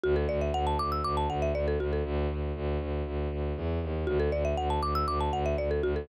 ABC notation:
X:1
M:4/4
L:1/16
Q:1/4=119
K:D
V:1 name="Marimba"
F A d e f a d' e' d' a f e d A F A | z16 | F A d e f a d' e' d' a f e d A F A |]
V:2 name="Violin" clef=bass
D,,2 D,,2 D,,2 D,,2 D,,2 D,,2 D,,2 D,,2 | D,,2 D,,2 D,,2 D,,2 D,,2 D,,2 E,,2 ^D,,2 | D,,2 D,,2 D,,2 D,,2 D,,2 D,,2 D,,2 D,,2 |]